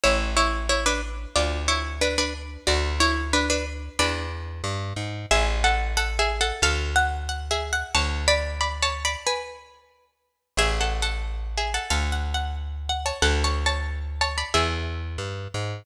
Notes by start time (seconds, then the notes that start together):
0.04 A1 E4 C#5
0.37 E4 C#5
0.69 E4 C#5
0.86 D4 B4
1.35 D2 F4 D5
1.68 E4 C#5
2.01 D4 B4
2.18 D4 B4
2.67 D2 F#4 D5
3.00 E4 C#5
3.33 D4 B4
3.50 D4 B4
3.99 E2 D4 B4
4.64 G2
4.96 G#2
5.31 A1 G#4 E5
5.64 A4 F#5
5.97 A4 F#5
6.19 G#4 E5
6.41 A4 F#5
6.62 D2 A4 F5
6.96 F#5
7.29 F#5
7.51 G#4 E5
7.73 F#5
7.95 D2 C#5 A5
8.28 D5 B5
8.61 D5 B5
8.82 C#5 A5
9.05 D5 B5
9.27 B4 G#5
10.57 A1 G#4 E5
10.80 A4 F#5
11.02 A4 F#5
11.57 G#4 E5
11.74 A4 F#5
11.90 D2 A4 F5
12.12 F#5
12.34 F#5
12.89 F#5
13.06 C#5 A5
13.22 D2 A4 F#5
13.44 C#5 A5
13.66 C#5 A5
14.21 C#5 A5
14.38 D5 B5
14.54 E2 G#4 E5
15.18 G2
15.54 G#2